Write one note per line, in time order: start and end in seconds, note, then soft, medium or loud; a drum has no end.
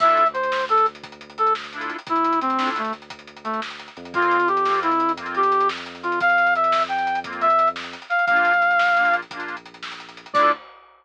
0.00 1.91 D2 medium
0.00 0.24 D4 medium
0.00 0.24 E4 medium
0.00 0.24 F4 medium
0.00 0.27 E5 loud
0.00 kick medium
0.00 crash loud
0.06 0.24 A4 medium
0.06 closed hi-hat medium
0.17 closed hi-hat medium
0.26 closed hi-hat medium
0.33 0.65 C5 medium
0.33 closed hi-hat medium
0.43 closed hi-hat medium
0.52 snare loud
0.61 closed hi-hat medium
0.69 0.86 A4 medium
0.69 closed hi-hat medium
0.78 closed hi-hat medium
0.86 closed hi-hat medium
0.95 closed hi-hat medium
1.03 kick medium
1.03 closed hi-hat medium
1.12 closed hi-hat medium
1.21 closed hi-hat medium
1.30 closed hi-hat medium
1.38 1.53 A4 medium
1.38 closed hi-hat medium
1.47 closed hi-hat medium
1.55 snare medium
1.64 closed hi-hat medium
1.73 1.97 D4 medium
1.73 1.97 E4 medium
1.73 closed hi-hat medium
1.77 1.97 F4 medium
1.77 1.97 A4 medium
1.81 closed hi-hat medium
1.90 closed hi-hat medium
1.99 closed hi-hat medium
2.07 3.88 D2 medium
2.07 2.39 E4 medium
2.07 kick loud
2.07 closed hi-hat loud
2.16 closed hi-hat medium
2.24 closed hi-hat medium
2.33 closed hi-hat medium
2.41 2.70 C4 medium
2.41 closed hi-hat medium
2.50 closed hi-hat medium
2.58 2.82 D4 medium
2.58 2.82 E4 medium
2.58 snare loud
2.62 2.82 F4 medium
2.62 2.82 A4 medium
2.67 closed hi-hat medium
2.76 2.93 A3 medium
2.76 closed hi-hat medium
2.84 closed hi-hat medium
2.93 closed hi-hat medium
3.02 closed hi-hat medium
3.10 kick medium
3.10 closed hi-hat loud
3.19 closed hi-hat medium
3.27 closed hi-hat medium
3.36 closed hi-hat medium
3.44 3.60 A3 medium
3.44 closed hi-hat medium
3.54 closed hi-hat medium
3.62 snare loud
3.71 closed hi-hat medium
3.80 closed hi-hat medium
3.88 closed hi-hat medium
3.97 7.95 F2 medium
3.97 closed hi-hat medium
4.05 closed hi-hat medium
4.13 4.37 A#3 medium
4.13 4.37 C4 medium
4.13 4.48 F4 loud
4.13 kick loud
4.13 closed hi-hat medium
4.18 4.37 F4 medium
4.22 closed hi-hat medium
4.31 closed hi-hat medium
4.40 closed hi-hat medium
4.48 4.80 G4 medium
4.48 closed hi-hat medium
4.57 closed hi-hat medium
4.65 4.90 A#3 medium
4.65 4.90 C4 medium
4.65 snare medium
4.71 4.90 F4 medium
4.71 closed hi-hat medium
4.83 5.12 E4 medium
4.83 closed hi-hat medium
4.92 closed hi-hat medium
5.00 closed hi-hat medium
5.09 closed hi-hat medium
5.17 5.41 A#3 medium
5.17 5.41 C4 medium
5.17 kick medium
5.17 closed hi-hat loud
5.22 5.41 F4 medium
5.26 closed hi-hat medium
5.35 5.68 G4 medium
5.35 closed hi-hat medium
5.43 closed hi-hat medium
5.52 closed hi-hat medium
5.60 closed hi-hat medium
5.69 snare loud
5.78 closed hi-hat medium
5.86 closed hi-hat medium
5.95 closed hi-hat medium
6.03 6.19 F4 medium
6.03 closed hi-hat medium
6.12 closed hi-hat medium
6.20 6.54 F5 loud
6.20 kick loud
6.20 closed hi-hat medium
6.29 closed hi-hat medium
6.38 closed hi-hat medium
6.47 closed hi-hat medium
6.55 6.83 E5 medium
6.55 closed hi-hat medium
6.64 closed hi-hat medium
6.72 snare loud
6.81 closed hi-hat medium
6.89 7.19 G5 medium
6.89 closed hi-hat medium
6.98 closed hi-hat medium
7.07 closed hi-hat medium
7.15 closed hi-hat medium
7.24 7.48 A#3 medium
7.24 7.48 C4 medium
7.24 kick medium
7.24 closed hi-hat loud
7.28 7.48 F4 medium
7.33 closed hi-hat medium
7.41 7.69 E5 medium
7.41 closed hi-hat medium
7.50 closed hi-hat medium
7.59 closed hi-hat medium
7.67 closed hi-hat medium
7.76 snare loud
7.84 closed hi-hat medium
7.93 closed hi-hat medium
8.02 closed hi-hat medium
8.10 8.25 F5 medium
8.10 closed hi-hat medium
8.19 closed hi-hat medium
8.26 9.23 A#1 medium
8.26 8.53 A#3 medium
8.26 9.16 F5 loud
8.26 kick medium
8.26 closed hi-hat medium
8.31 8.53 D4 medium
8.31 8.53 F4 loud
8.36 closed hi-hat medium
8.45 closed hi-hat medium
8.53 closed hi-hat medium
8.62 closed hi-hat medium
8.71 closed hi-hat medium
8.79 snare loud
8.88 closed hi-hat medium
8.96 9.21 A#3 medium
8.96 9.21 D4 medium
8.96 closed hi-hat medium
9.01 9.21 F4 medium
9.05 closed hi-hat medium
9.14 closed hi-hat medium
9.22 closed hi-hat medium
9.30 10.26 A#1 medium
9.30 9.56 A#3 medium
9.30 9.56 D4 medium
9.30 kick medium
9.30 closed hi-hat loud
9.36 9.56 F4 medium
9.36 closed hi-hat medium
9.48 closed hi-hat medium
9.57 closed hi-hat medium
9.66 closed hi-hat medium
9.74 closed hi-hat medium
9.83 snare loud
9.91 closed hi-hat medium
10.00 closed hi-hat medium
10.09 closed hi-hat medium
10.17 closed hi-hat medium
10.26 closed hi-hat medium
10.33 10.51 D2 medium
10.33 10.52 D4 loud
10.33 10.52 E4 loud
10.33 10.52 D5 loud
10.33 kick loud
10.33 crash loud
10.38 10.52 F4 loud
10.38 10.52 A4 loud